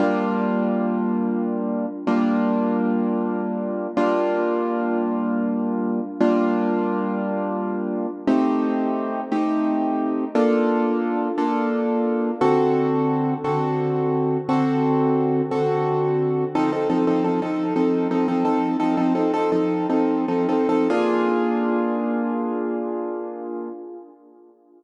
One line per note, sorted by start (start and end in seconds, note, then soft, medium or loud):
0.00 1.86 G3 loud
0.00 1.86 A#3 medium
0.00 1.86 D4 medium
0.00 1.86 F4 medium
2.07 3.87 G3 medium
2.07 3.87 A#3 medium
2.07 3.87 D4 medium
2.07 3.87 F4 medium
3.97 6.00 G3 medium
3.97 6.00 A#3 medium
3.97 6.00 D4 medium
3.97 6.00 F4 loud
6.20 8.07 G3 medium
6.20 8.07 A#3 medium
6.20 8.07 D4 loud
6.20 8.07 F4 medium
8.27 9.21 A3 medium
8.27 9.21 C4 medium
8.27 9.21 D#4 medium
8.27 9.21 G4 medium
9.32 10.25 A3 medium
9.32 10.25 C4 medium
9.32 10.25 D#4 medium
9.32 10.25 G4 medium
10.35 11.28 A#3 medium
10.35 11.28 D4 medium
10.35 11.28 F4 medium
10.35 11.28 A4 medium
11.38 12.31 A#3 medium
11.38 12.31 D4 medium
11.38 12.31 F4 medium
11.38 12.31 A4 medium
12.41 13.34 D3 medium
12.41 13.34 C4 medium
12.41 13.34 F#4 loud
12.41 13.34 A4 medium
13.44 14.38 D3 medium
13.44 14.38 C4 medium
13.44 14.38 F#4 medium
13.44 14.38 A4 medium
14.49 15.42 D3 medium
14.49 15.42 C4 medium
14.49 15.42 F#4 medium
14.49 15.42 A4 medium
15.51 16.44 D3 medium
15.51 16.44 C4 medium
15.51 16.44 F#4 medium
15.51 16.44 A4 medium
16.55 16.71 F3 medium
16.55 16.71 C4 medium
16.55 16.71 D#4 loud
16.55 16.71 A4 medium
16.72 16.88 F3 medium
16.72 16.88 C4 medium
16.72 16.88 D#4 medium
16.72 16.88 A4 medium
16.90 17.05 F3 medium
16.90 17.05 C4 medium
16.90 17.05 D#4 medium
16.90 17.05 A4 medium
17.07 17.23 F3 medium
17.07 17.23 C4 medium
17.07 17.23 D#4 medium
17.07 17.23 A4 medium
17.24 17.40 F3 medium
17.24 17.40 C4 medium
17.24 17.40 D#4 medium
17.24 17.40 A4 medium
17.42 17.74 F3 medium
17.42 17.74 C4 medium
17.42 17.74 D#4 medium
17.42 17.74 A4 medium
17.76 18.08 F3 medium
17.76 18.08 C4 medium
17.76 18.08 D#4 medium
17.76 18.08 A4 medium
18.11 18.27 F3 medium
18.11 18.27 C4 medium
18.11 18.27 D#4 medium
18.11 18.27 A4 medium
18.28 18.44 F3 medium
18.28 18.44 C4 medium
18.28 18.44 D#4 medium
18.28 18.44 A4 medium
18.45 18.77 F3 medium
18.45 18.77 C4 medium
18.45 18.77 D#4 medium
18.45 18.77 A4 medium
18.80 18.96 F3 medium
18.80 18.96 C4 medium
18.80 18.96 D#4 medium
18.80 18.96 A4 medium
18.97 19.14 F3 medium
18.97 19.14 C4 medium
18.97 19.14 D#4 medium
18.97 19.14 A4 medium
19.15 19.32 F3 medium
19.15 19.32 C4 medium
19.15 19.32 D#4 medium
19.15 19.32 A4 medium
19.34 19.50 F3 medium
19.34 19.50 C4 medium
19.34 19.50 D#4 medium
19.34 19.50 A4 medium
19.52 19.87 F3 medium
19.52 19.87 C4 medium
19.52 19.87 D#4 medium
19.52 19.87 A4 medium
19.90 20.25 F3 medium
19.90 20.25 C4 medium
19.90 20.25 D#4 medium
19.90 20.25 A4 medium
20.28 20.47 F3 medium
20.28 20.47 C4 medium
20.28 20.47 D#4 medium
20.28 20.47 A4 medium
20.49 20.67 F3 medium
20.49 20.67 C4 medium
20.49 20.67 D#4 medium
20.49 20.67 A4 medium
20.69 20.88 F3 medium
20.69 20.88 C4 medium
20.69 20.88 D#4 medium
20.69 20.88 A4 medium
20.90 23.69 A#3 medium
20.90 23.69 D4 medium
20.90 23.69 F4 loud
20.90 23.69 G#4 loud